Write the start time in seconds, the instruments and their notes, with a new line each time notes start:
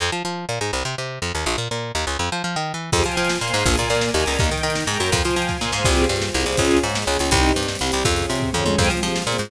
0.00 electric bass (finger) F2
0.12 electric bass (finger) F3
0.25 electric bass (finger) F3
0.49 electric bass (finger) A#2
0.61 electric bass (finger) G#2
0.73 electric bass (finger) C2
0.85 electric bass (finger) C3
0.98 electric bass (finger) C3
1.22 electric bass (finger) F2
1.35 electric bass (finger) D#2
1.46 electric bass (finger) A#1
1.58 electric bass (finger) A#2
1.71 electric bass (finger) A#2
1.95 electric bass (finger) D#2
2.07 electric bass (finger) C#2
2.19 electric bass (finger) F2
2.32 electric bass (finger) F3
2.44 electric bass (finger) F3
2.56 electric bass (finger) D#3
2.74 electric bass (finger) E3
2.92 electric bass (finger) F2, string ensemble 1 C4 F4 G4 G#4 C5 F5 G5 G#5, kick, crash
2.99 closed hi-hat
3.04 electric bass (finger) F3, string ensemble 1 F4, closed hi-hat
3.12 closed hi-hat
3.17 electric bass (finger) F3, string ensemble 1 F4, closed hi-hat
3.25 closed hi-hat
3.29 string ensemble 1 C5 F5 G#5 C6, snare
3.35 closed hi-hat
3.41 electric bass (finger) A#2, string ensemble 1 A#3, closed hi-hat
3.48 closed hi-hat
3.54 electric bass (finger) G#2, string ensemble 1 G#3, closed hi-hat
3.59 closed hi-hat
3.66 electric bass (finger) A#1, string ensemble 1 A#3 D4 F4 G#4 A#4 D5 F5 G#5, kick, closed hi-hat
3.71 closed hi-hat
3.78 electric bass (finger) A#2, string ensemble 1 A#3, closed hi-hat
3.84 closed hi-hat
3.90 electric bass (finger) A#2, string ensemble 1 A#3, closed hi-hat
3.95 closed hi-hat
4.01 string ensemble 1 A#4 D5 G#5 A#5, snare
4.09 closed hi-hat
4.14 electric bass (finger) D#2, string ensemble 1 D#3, closed hi-hat
4.20 closed hi-hat
4.26 electric bass (finger) C#2, string ensemble 1 C#3, closed hi-hat
4.33 open hi-hat
4.39 electric bass (finger) D#2, string ensemble 1 A#3 D#4 G4 A#4 D#5 G5, kick, closed hi-hat
4.44 closed hi-hat
4.51 electric bass (finger) D#3, string ensemble 1 D#4, closed hi-hat
4.58 closed hi-hat
4.63 electric bass (finger) D#3, string ensemble 1 D#4, closed hi-hat
4.70 closed hi-hat
4.75 string ensemble 1 A#4 G5 A#5, snare
4.81 closed hi-hat
4.87 electric bass (finger) G#2, string ensemble 1 G#3, closed hi-hat
4.94 closed hi-hat
5.00 electric bass (finger) F#2, string ensemble 1 F#3, closed hi-hat
5.06 closed hi-hat
5.12 electric bass (finger) F2, string ensemble 1 C5 F5 G5 G#5, kick, closed hi-hat
5.17 closed hi-hat
5.24 electric bass (finger) F3, string ensemble 1 F4, closed hi-hat
5.31 closed hi-hat
5.36 electric bass (finger) F3, string ensemble 1 F4, closed hi-hat
5.42 closed hi-hat
5.49 string ensemble 1 C5 F5 G#5 C6, kick, snare
5.61 electric bass (finger) A#2, string ensemble 1 A#3, snare
5.72 electric bass (finger) G#2, string ensemble 1 G#3, snare
5.85 electric bass (finger) C2, string ensemble 1 C4 F4 G4 G#4, kick, crash
5.92 closed hi-hat
5.97 closed hi-hat
6.04 closed hi-hat
6.09 electric bass (finger) G2, string ensemble 1 G3, closed hi-hat
6.16 closed hi-hat
6.22 string ensemble 1 C4 F4 G#4 C5, snare
6.28 closed hi-hat
6.34 electric bass (finger) C2, string ensemble 1 C3, closed hi-hat
6.40 closed hi-hat
6.46 electric bass (finger) C2, string ensemble 1 C3, closed hi-hat
6.52 closed hi-hat
6.57 electric bass (finger) C#2, string ensemble 1 C#4 F4 G#4, kick, closed hi-hat
6.65 closed hi-hat
6.71 closed hi-hat
6.77 closed hi-hat
6.83 electric bass (finger) G#2, string ensemble 1 G#3, closed hi-hat
6.90 closed hi-hat
6.94 string ensemble 1 C#4 G#4 C#5, snare
7.02 closed hi-hat
7.07 electric bass (finger) C#2, string ensemble 1 C#3, closed hi-hat
7.14 closed hi-hat
7.19 electric bass (finger) C#2, string ensemble 1 C#3, closed hi-hat
7.26 closed hi-hat
7.31 electric bass (finger) C2, string ensemble 1 C4 D#4 G4, kick, closed hi-hat
7.37 closed hi-hat
7.43 closed hi-hat
7.49 closed hi-hat
7.56 electric bass (finger) G2, string ensemble 1 G3, closed hi-hat
7.63 closed hi-hat
7.68 string ensemble 1 G3 C4 G4, snare
7.75 closed hi-hat
7.79 electric bass (finger) C2, string ensemble 1 C3, closed hi-hat
7.87 closed hi-hat
7.92 electric bass (finger) C2, string ensemble 1 C3, closed hi-hat
7.99 closed hi-hat
8.05 electric bass (finger) F2, string ensemble 1 C#4 F4 G#4, kick, closed hi-hat
8.11 closed hi-hat
8.16 closed hi-hat
8.22 closed hi-hat
8.29 electric bass (finger) C3, string ensemble 1 C4, closed hi-hat
8.35 closed hi-hat
8.40 string ensemble 1 C#4 G#4 C#5, kick, floor tom
8.53 electric bass (finger) F2, string ensemble 1 F3, mid tom
8.65 electric bass (finger) F2, string ensemble 1 F3, high tom
8.78 electric bass (finger) F2, string ensemble 1 C4 F4 G4 G#4 C5 F5 G5 G#5, kick, crash
8.85 closed hi-hat
8.90 electric bass (finger) F3, string ensemble 1 F4, closed hi-hat
8.97 closed hi-hat
9.02 electric bass (finger) F3, string ensemble 1 F4, closed hi-hat
9.08 closed hi-hat
9.15 string ensemble 1 C4 F4 G#4 C5, snare
9.22 closed hi-hat
9.27 electric bass (finger) A#2, string ensemble 1 A#3, closed hi-hat
9.32 closed hi-hat
9.38 electric bass (finger) G#2, string ensemble 1 G#3, closed hi-hat
9.45 closed hi-hat